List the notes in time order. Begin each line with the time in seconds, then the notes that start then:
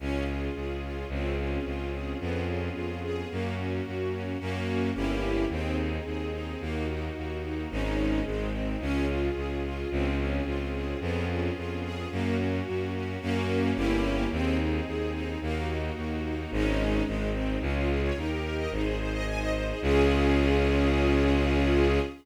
0.00 C#2 C#4 F4 G#4
0.27 F4
0.55 C#2 G#4
0.83 F4
1.09 C#2 C4 C#4 F4 G#4
1.38 C#4
1.65 C#2 F4
1.92 G#4
2.20 F2 B3 C#4 F4 G#4
2.48 C#4
2.75 F2 F4
3.03 G#4
3.30 F#2 A#3 C#4 F#4
3.57 C#4
3.85 F#2 F#4
4.12 C#4
4.39 F#2 A#3 C#4 F#4
4.95 G1 A#3 C#4 E4 G4
5.49 D#2 C4 D#4 G#4
5.78 D#4
6.05 D#2 G#4
6.33 D#4
6.60 D#2 A#3 D#4 F#4
6.88 D#4
7.16 D#2 F#4
7.43 D#4
7.71 G#1 G#3 C#4 D#4
8.25 G#1 G#3 C4 D#4
8.52 C4
8.80 C#2 C#4 F4 G#4
9.09 F4
9.35 C#2 G#4
9.64 F4
9.90 C#2 C4 C#4 F4 G#4
10.18 C#4
10.45 C#2 F4
10.73 G#4
11.01 F2 B3 C#4 F4 G#4
11.29 C#4
11.56 F2 F4
11.83 G#4
12.11 F#2 A#3 C#4 F#4
12.37 C#4
12.66 F#2 F#4
12.94 C#4
13.21 F#2 A#3 C#4 F#4
13.75 G1 A#3 C#4 E4 G4
14.30 D#2 C4 D#4 G#4
14.59 D#4
14.86 D#2 G#4
15.14 D#4
15.41 D#2 A#3 D#4 F#4
15.68 D#4
15.96 D#2 F#4
16.24 D#4
16.51 G#1 G#3 C#4 D#4
17.06 G#1 G#3 C4 D#4
17.33 C4
17.61 C#2 C#4 F4 G#4
17.76 F4
17.89 G#4
18.03 C#5
18.17 D#2 D#4 G4 A#4
18.31 G4
18.44 A#4
18.57 D#5
18.71 G#1 D#4 G#4 C5
18.84 G#4
18.99 C5
19.13 D#5
19.26 D#4 C5 D#5 G#5
19.40 D#5
19.54 C5
19.68 G#4
19.82 C#2 C#4 F4 G#4